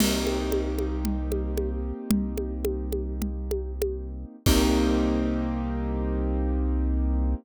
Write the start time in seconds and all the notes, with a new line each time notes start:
0.00 C2 A#3 C4 D#4 G4, crash, low conga
0.27 high conga
0.52 high conga
0.79 high conga
1.05 low conga
1.32 high conga
1.57 high conga
2.11 C2, low conga
2.38 high conga
2.65 high conga
2.92 high conga
3.22 low conga
3.51 high conga
3.82 high conga
4.46 C2 A#3 C4 D#4 G4, kick, crash